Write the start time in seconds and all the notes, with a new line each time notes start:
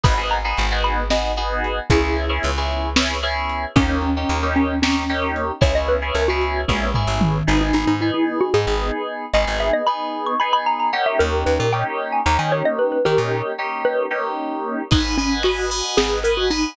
0.04 G#1 B3 D#4 F#4 G#4 B5, kick, crash
0.17 B3 D#4 F#4 G#4
0.31 A#5, closed hi-hat
0.44 B3 D#4 F#4 G#4
0.57 G#1, closed hi-hat
0.71 B3 D#4 F#4 G#4
0.84 B5, closed hi-hat
1.10 B3 D#4 F#4 G#4 D#5, snare
1.37 B3 D#4 F#4 G#4, closed hi-hat
1.64 closed hi-hat
1.90 C#2 B3 C#4 E4 G#4, kick, closed hi-hat
2.03 B3 C#4 E4 G#4
2.17 closed hi-hat
2.29 B3 C#4 E4 G#4
2.43 C#2, closed hi-hat
2.57 B3 C#4 E4 G#4
2.71 closed hi-hat
2.96 B3 C#4 E4 G#4, snare
3.23 B3 C#4 E4 G#4, closed hi-hat
3.49 closed hi-hat
3.76 D#2 A#3 C#4 D#4 G4, kick, closed hi-hat
3.88 A#3 C#4 D#4 G4
4.02 C#4, closed hi-hat
4.16 A#3 C#4 D#4 G4
4.29 D#2, closed hi-hat
4.43 A#3 C#4 D#4 G4
4.56 C#4, closed hi-hat
4.82 A#3 C#4 D#4 G4, snare
5.09 A#3 C#4 D#4 G4, closed hi-hat
5.36 closed hi-hat
5.61 C#2 B3 C#4 E4 G#4 C#5, kick, closed hi-hat
5.75 B3 C#4 E4 G#4 D#5
5.88 B4, closed hi-hat
6.02 B3 C#4 E4 G#4
6.15 C#2 A#4, closed hi-hat
6.28 B3 C#4 E4 F#4 G#4
6.41 closed hi-hat
6.68 A#1 B3 C#4 E4 G#4, kick, high tom
6.94 B3 C#4 E4 G#4, floor tom
7.07 A1
7.21 mid tom
7.47 G#1 B3 D#4 G#4
7.61 D#4
7.73 G#1 D#4
7.87 G#2 D#4
8.01 B3 D#4 E4 G#4
8.14 E4
8.41 F#4
8.54 G#2 B3 D#4 G#4
8.67 G#1
9.34 G#1 B3 D#4 G#4 D#5
9.47 G#1
9.60 E5
9.73 D#5
9.87 B3 D#4 G#4 B5
10.26 C#6
10.40 B3 D#4 G#4 B5
10.53 B5
10.66 A#5
10.80 A#5
10.93 A#3 C#4 D#4 G4 F#5
11.06 E5
11.19 D#2 A#4
11.46 D#2 B4
11.59 A#2 A#4
11.73 A#3 C#4 D#4 G4 G5
12.12 G#5
12.26 D#2 A#3 C#4 D#4 G4 A#5
12.39 D#3 G#5
12.52 C#5
12.65 D#5
12.79 B4
12.92 B4
13.05 D#3 A#3 C#4 D#4 G4 A#4
13.18 A#2
13.58 A#3 C#4 D#4 G4
13.85 B4
14.11 A#3 C#4 D#4 G4
14.91 G#1 D#4 B4 D#5 F#5 G#5, kick, crash
15.18 C#4 B4 D#5 F#5 G#5, ride
15.43 F#4 B4 D#5 F#5 G#5, ride
15.70 B4 D#5 F#5 G#5, ride
15.97 G#1 G#4, snare
16.23 A#4 B4 D#5 F#5 G#5, ride
16.37 F#4
16.50 D#4 B4 D#5 F#5 G#5, ride